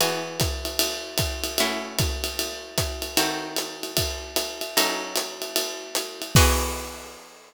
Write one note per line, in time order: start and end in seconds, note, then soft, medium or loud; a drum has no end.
0.00 1.57 E3 medium
0.00 1.57 B3 medium
0.00 1.57 F#4 medium
0.00 1.57 G#4 medium
0.00 ride loud
0.40 kick medium
0.40 hi-hat pedal medium
0.40 ride medium
0.65 ride medium
0.79 ride loud
1.18 kick medium
1.18 hi-hat pedal medium
1.18 ride loud
1.44 ride medium
1.58 3.17 A3 medium
1.58 3.17 C#4 medium
1.58 3.17 E4 medium
1.58 3.17 F#4 medium
1.58 ride loud
1.99 kick medium
1.99 hi-hat pedal medium
1.99 ride loud
2.24 ride medium
2.39 ride medium
2.78 kick medium
2.78 hi-hat pedal medium
2.78 ride medium
3.02 ride medium
3.17 4.74 D#3 medium
3.17 4.74 C4 medium
3.17 4.74 F#4 medium
3.17 4.74 A4 medium
3.17 ride loud
3.56 hi-hat pedal medium
3.56 ride medium
3.83 ride medium
3.97 kick medium
3.97 ride loud
4.36 hi-hat pedal medium
4.36 ride loud
4.61 ride medium
4.77 6.33 F#3 medium
4.77 6.33 C#4 medium
4.77 6.33 D#4 medium
4.77 6.33 A4 medium
4.77 ride loud
5.16 hi-hat pedal medium
5.16 ride medium
5.42 ride medium
5.56 ride loud
5.95 hi-hat pedal loud
5.95 ride medium
6.22 ride medium
6.35 7.54 E3 loud
6.35 7.54 B3 loud
6.35 7.54 F#4 medium
6.35 7.54 G#4 loud
6.35 kick loud
6.35 crash loud